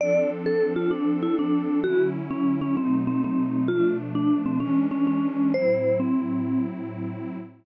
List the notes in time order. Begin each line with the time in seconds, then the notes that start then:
0.00 F3 C4 D4 A4 D5
0.46 A4
0.76 F4
0.91 D4
1.22 E4
1.39 D4
1.84 D3 F#3 C#4 E4 F#4
2.30 C#4
2.61 C#4
2.77 B2 F#3 A3 C4 D#4
3.07 C4
3.24 C4
3.68 B2 F3 A3 D4 F4
4.15 D4
4.46 C4
4.60 E3 G#3 C#4 D4
4.91 C#4
5.07 C#4
5.54 A2 F#3 C4 E4 C5
6.00 C4